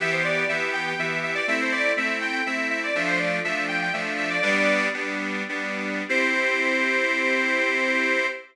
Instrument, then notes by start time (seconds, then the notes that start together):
accordion
0.00 E3 B3 G4 E5
0.12 C5
0.24 D5
0.48 E3 B3 G4 E5
0.73 G5
0.87 G5
0.98 E3 B3 G4 E5
1.23 E5
1.35 D5
1.47 A3 C4 E4 E5
1.61 C5
1.72 D5
1.97 A3 C4 E4 E5
2.21 G5
2.32 G5
2.46 A3 C4 E4 E5
2.70 E5
2.83 D5
2.95 F3 A3 D4 E5
3.07 C5
3.19 D5
3.44 F3 A3 D4 E5
3.68 G5
3.82 G5
3.93 F3 A3 D4 E5
4.18 E5
4.30 D5
4.42 G3 B3 D4 D5
4.94 G3 B3 D4
5.49 G3 B3 D4
6.09 C4 E4 G4 C5